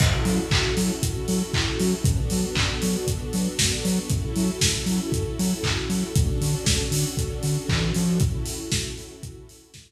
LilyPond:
<<
  \new Staff \with { instrumentName = "String Ensemble 1" } { \time 4/4 \key fis \minor \tempo 4 = 117 <cis' e' fis' a'>1 | <b d' fis' a'>1 | <cis' e' fis' a'>1 | <cis' d' fis' a'>1 |
<cis' e' fis' a'>1 | }
  \new Staff \with { instrumentName = "Synth Bass 2" } { \clef bass \time 4/4 \key fis \minor fis,8 fis8 fis,8 fis8 fis,8 fis8 fis,8 fis8 | fis,8 fis8 fis,8 fis8 fis,8 fis8 fis,8 fis8 | fis,8 fis8 fis,8 fis8 fis,8 fis8 fis,8 fis8 | d,8 d8 d,8 d8 d,8 d8 e8 eis8 |
r1 | }
  \new DrumStaff \with { instrumentName = "Drums" } \drummode { \time 4/4 <cymc bd>8 hho8 <hc bd>8 hho8 <hh bd>8 hho8 <hc bd>8 hho8 | <hh bd>8 hho8 <hc bd>8 hho8 <hh bd>8 hho8 <bd sn>8 hho8 | <hh bd>8 hho8 <bd sn>8 hho8 <hh bd>8 hho8 <hc bd>8 hho8 | <hh bd>8 hho8 <bd sn>8 hho8 <hh bd>8 hho8 <hc bd>8 hho8 |
<hh bd>8 hho8 <bd sn>8 hho8 <hh bd>8 hho8 <bd sn>4 | }
>>